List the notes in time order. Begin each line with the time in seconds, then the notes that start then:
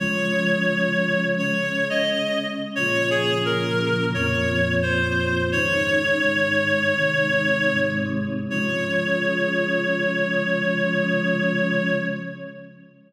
0.00 C#3 F3 G#3 C#5
1.38 C#3 G#3 C#4 C#5
1.90 D#5
2.75 A#2 C#3 F3 C#5
3.10 G#4
3.45 A#4
4.14 F2 A#2 F3 C#5
4.82 C5
5.52 G#2 C#3 D#3 C#5
6.22 G#2 D#3 G#3
6.95 C3 D#3 G#3
7.70 G#2 C3 G#3
8.50 C#3 F3 G#3 C#5